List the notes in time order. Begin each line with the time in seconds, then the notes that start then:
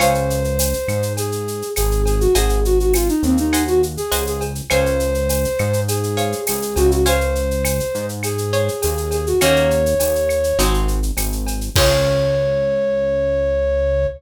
0.00 C#2 C5 C#5 F5 G#5, cowbell, claves, shaker
0.14 shaker
0.30 shaker
0.44 shaker
0.59 tambourine, cowbell, shaker
0.73 shaker
0.88 G#2, claves, shaker
1.02 shaker
1.17 G#4, cowbell, shaker
1.32 shaker
1.48 shaker
1.62 shaker
1.76 G#1 G#4, tambourine, cowbell, claves, shaker
1.91 shaker
2.05 G#4, cowbell, shaker
2.20 F#4, shaker
2.35 G#1 G#4 C5 D#5 F#5 G#5, cowbell, shaker
2.49 shaker
2.65 F#4, shaker
2.79 F#4, shaker
2.94 F4, tambourine, cowbell, claves, shaker
3.08 D#4, shaker
3.23 D#2 C4, shaker
3.37 D#4, shaker
3.53 C5 D#5 F#5 G#5, cowbell, claves, shaker
3.67 F#4, shaker
3.83 shaker
3.97 G#4, shaker
4.12 C#2 C5 D#5 F#5 G#5, tambourine, cowbell, shaker
4.27 G#4, shaker
4.41 cowbell, shaker
4.55 shaker
4.70 C#2 C5 C#5 F5 G#5, cowbell, claves, shaker
4.86 shaker
5.00 shaker
5.14 shaker
5.29 tambourine, cowbell, shaker
5.44 shaker
5.59 G#2, claves, shaker
5.73 shaker
5.88 G#4, cowbell, shaker
6.03 shaker
6.17 C5 C#5 F5 G#5, shaker
6.32 shaker
6.47 C#2 G#4, tambourine, cowbell, claves, shaker
6.62 shaker
6.76 C#2 F#4, cowbell, shaker
6.91 F#4, shaker
7.06 C5 C#5 F5 G#5, cowbell, shaker
7.21 shaker
7.35 shaker
7.51 shaker
7.65 tambourine, cowbell, claves, shaker
7.80 shaker
7.94 G#2, shaker
8.09 shaker
8.23 G#4, cowbell, claves, shaker
8.38 shaker
8.53 C5 C#5 F5 G#5, shaker
8.68 shaker
8.82 D#2 G#4, tambourine, cowbell, shaker
8.97 shaker
9.11 G#4, cowbell, shaker
9.27 F#4, shaker
9.41 D#2 A#3 C#4 D#4 F#4 C#5, cowbell, claves, shaker
9.56 shaker
9.71 shaker
9.86 shaker
10.00 D#2, tambourine, cowbell, shaker
10.15 shaker
10.29 claves, shaker
10.44 shaker
10.59 G#1 G#3 C4 D#4 F#4, cowbell, shaker
10.74 shaker
10.88 shaker
11.03 shaker
11.17 G#1, tambourine, cowbell, claves, shaker
11.32 shaker
11.47 cowbell, shaker
11.61 shaker
11.76 C#2 C4 C#4 F4 G#4 C#5, kick, crash